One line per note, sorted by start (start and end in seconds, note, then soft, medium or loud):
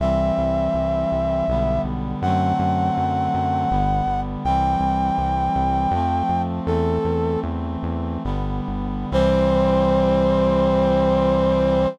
0.00 0.32 C2 medium
0.00 1.46 E3 medium
0.00 1.46 G3 medium
0.00 1.46 C4 medium
0.00 1.81 E5 medium
0.38 0.69 C2 medium
0.74 1.06 C2 medium
1.12 1.43 C2 medium
1.48 1.80 B1 medium
1.48 2.23 D3 medium
1.48 2.23 G3 medium
1.48 2.23 B3 medium
1.84 2.15 B1 medium
2.22 2.53 F#2 loud
2.22 3.70 D3 medium
2.22 3.70 F#3 medium
2.22 3.70 A3 medium
2.22 3.70 C4 medium
2.22 4.20 F#5 medium
2.59 2.91 F#2 medium
2.97 3.29 F#2 medium
3.34 3.66 F#2 medium
3.70 4.02 G1 loud
3.70 4.44 D3 medium
3.70 4.44 G3 medium
3.70 4.44 B3 medium
4.06 4.38 G1 medium
4.44 4.76 C2 medium
4.44 5.92 E3 medium
4.44 5.92 G3 medium
4.44 5.92 C4 medium
4.44 6.42 G5 medium
4.80 5.11 C2 medium
5.18 5.49 C2 medium
5.56 5.87 C2 medium
5.91 6.23 F2 medium
5.91 6.67 F3 medium
5.91 6.66 A3 medium
5.91 6.66 C4 medium
6.29 6.60 F2 medium
6.67 6.99 E2 medium
6.67 8.23 E3 medium
6.67 8.23 A3 medium
6.67 8.23 C4 medium
6.67 7.40 A4 medium
7.04 7.37 E2 medium
7.43 7.77 E2 medium
7.83 8.18 E2 medium
8.24 8.61 G1 medium
8.24 9.10 D3 medium
8.24 9.10 G3 medium
8.24 9.10 B3 medium
8.68 9.06 G1 medium
9.11 11.87 C2 medium
9.11 11.86 E3 loud
9.11 11.86 G3 loud
9.11 11.86 C4 loud
9.11 11.88 C5 loud